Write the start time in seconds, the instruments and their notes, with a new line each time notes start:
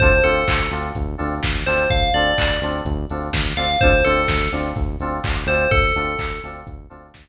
0.00 synth bass 1 D2, electric piano 2 C4 D4 F4 A4, tubular bells C5, kick, crash
0.24 synth bass 1 D2, electric piano 2 C4 D4 F4 A4, tubular bells A4, open hi-hat
0.48 synth bass 1 D2, kick, clap
0.71 synth bass 1 D2, electric piano 2 C4 D4 F4 A4, open hi-hat
0.95 synth bass 1 D2, kick, closed hi-hat
1.18 synth bass 1 D2, electric piano 2 C4 D4 F4 A4, open hi-hat
1.43 synth bass 1 D2, kick, snare
1.66 synth bass 1 D2, electric piano 2 C4 D4 F4 A4, tubular bells C5, open hi-hat
1.90 synth bass 1 D2, tubular bells F5, kick, closed hi-hat
2.13 synth bass 1 D2, electric piano 2 C4 D4 F4 A4, tubular bells D5, open hi-hat
2.38 synth bass 1 D2, kick, clap
2.61 synth bass 1 D2, electric piano 2 C4 D4 F4 A4, open hi-hat
2.85 synth bass 1 D2, kick, closed hi-hat
3.10 synth bass 1 D2, electric piano 2 C4 D4 F4 A4, open hi-hat
3.33 synth bass 1 D2, kick, snare
3.56 synth bass 1 D2, electric piano 2 C4 D4 F4 A4, tubular bells F5, open hi-hat
3.80 synth bass 1 D2, electric piano 2 C4 D4 F4 A4, tubular bells C5, kick, closed hi-hat
4.05 synth bass 1 D2, electric piano 2 C4 D4 F4 A4, tubular bells A4, open hi-hat
4.28 synth bass 1 D2, kick, snare
4.52 synth bass 1 D2, electric piano 2 C4 D4 F4 A4, open hi-hat
4.76 synth bass 1 D2, kick, closed hi-hat
5.00 synth bass 1 D2, electric piano 2 C4 D4 F4 A4, open hi-hat
5.24 synth bass 1 D2, kick, clap
5.47 synth bass 1 D2, electric piano 2 C4 D4 F4 A4, tubular bells C5, open hi-hat
5.71 synth bass 1 D2, tubular bells A4, kick, closed hi-hat
5.95 synth bass 1 D2, electric piano 2 C4 D4 F4 A4, open hi-hat
6.19 synth bass 1 D2, kick, clap
6.43 synth bass 1 D2, electric piano 2 C4 D4 F4 A4, open hi-hat
6.67 synth bass 1 D2, kick, closed hi-hat
6.90 synth bass 1 D2, electric piano 2 C4 D4 F4 A4, open hi-hat
7.14 synth bass 1 D2, kick, snare